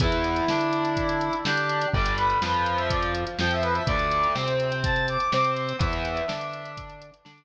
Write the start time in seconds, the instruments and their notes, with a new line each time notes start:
0.00 synth bass 1 E2, overdriven guitar E3 B3, brass section E4, kick, closed hi-hat
0.12 closed hi-hat
0.24 closed hi-hat
0.36 closed hi-hat
0.48 synth bass 1 D3, overdriven guitar D4, snare
0.61 closed hi-hat
0.73 closed hi-hat
0.85 closed hi-hat
0.97 kick, closed hi-hat
1.09 closed hi-hat
1.21 closed hi-hat
1.33 closed hi-hat
1.44 synth bass 1 D3, overdriven guitar D4, brass section G4, snare
1.57 closed hi-hat
1.69 closed hi-hat
1.81 closed hi-hat
1.93 synth bass 1 G1, overdriven guitar D3 G3, brass section D5, kick
2.06 closed hi-hat
2.16 brass section B4, closed hi-hat
2.30 closed hi-hat
2.42 synth bass 1 F2, overdriven guitar F3, brass section B4, snare
2.54 brass section B4, closed hi-hat
2.66 closed hi-hat
2.77 brass section E5, closed hi-hat
2.90 brass section D5, kick, closed hi-hat
3.02 closed hi-hat
3.15 closed hi-hat
3.27 closed hi-hat
3.39 synth bass 1 F2, overdriven guitar F3, brass section G5, snare
3.51 brass section E5, closed hi-hat
3.62 brass section B4, closed hi-hat
3.74 brass section E5, closed hi-hat
3.86 synth bass 1 D2, overdriven guitar D3 A3, brass section D5, kick, closed hi-hat
3.99 closed hi-hat
4.11 closed hi-hat
4.23 closed hi-hat
4.35 synth bass 1 C3, overdriven guitar C4, snare
4.48 closed hi-hat
4.60 closed hi-hat
4.72 closed hi-hat
4.84 brass section A5, kick, closed hi-hat
4.96 closed hi-hat
5.08 brass section D6, closed hi-hat
5.20 closed hi-hat
5.31 synth bass 1 C3, overdriven guitar C4, brass section D6, snare
5.44 closed hi-hat
5.56 closed hi-hat
5.69 closed hi-hat
5.79 synth bass 1 E2, overdriven guitar E3 B3, brass section E5, kick, closed hi-hat
5.93 closed hi-hat
6.05 closed hi-hat
6.17 closed hi-hat
6.28 synth bass 1 D3, overdriven guitar D4, snare
6.41 closed hi-hat
6.53 closed hi-hat
6.65 closed hi-hat
6.77 kick, closed hi-hat
6.90 closed hi-hat
7.02 closed hi-hat
7.14 closed hi-hat
7.25 synth bass 1 D3, overdriven guitar D4, snare
7.38 closed hi-hat